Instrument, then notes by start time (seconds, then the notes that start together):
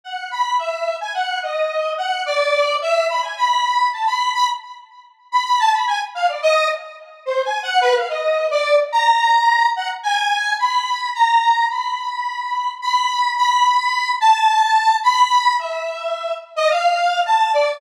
lead 1 (square)
0.04 F#5
0.31 B5
0.59 E5
1.01 G#5
1.14 F#5
1.43 D#5
1.98 F#5
2.26 D5
2.82 E5
3.09 B5
3.22 G#5
3.37 B5
3.92 A5
4.06 B5
4.34 B5
5.32 B5
5.45 B5
5.59 A5
5.73 B5
5.87 G#5
6.15 F5
6.28 D5
6.42 D#5
7.26 C5
7.44 G#5
7.63 F#5
7.81 B4
7.95 F5
8.09 D#5
8.51 D5
8.92 A#5
9.76 F#5
10.03 G#5
10.59 B5
11.14 A#5
11.70 B5
12.82 B5
13.37 B5
14.20 A5
15.03 B5
15.59 E5
16.56 D#5
16.70 F5
17.26 A5
17.53 D5